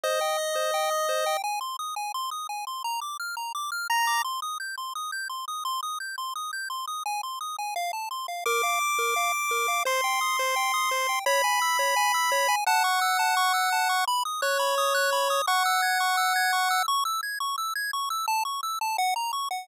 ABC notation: X:1
M:4/4
L:1/8
Q:1/4=171
K:Cm
V:1 name="Lead 1 (square)"
e8 | z8 | z6 b2 | z8 |
z8 | z8 | d'8 | c'8 |
[K:C#m] b8 | f8 | z2 c6 | f8 |
z8 | z8 |]
V:2 name="Lead 1 (square)"
c g e' c g e' c g | a c' e' a c' e' a c' | b d' f' b d' f' b d' | c' e' g' c' e' g' c' e' |
c' e' g' c' e' g' c' e' | a c' e' a f =a c' f | B f d' B f d' B f | c g e' c g e' c g |
[K:C#m] c g e' c g e' c g | a c' e' a c' e' a c' | b d' f' b d' f' b d' | c' e' g' c' e' g' c' e' |
c' e' g' c' e' g' c' e' | a c' e' a f ^a c' f |]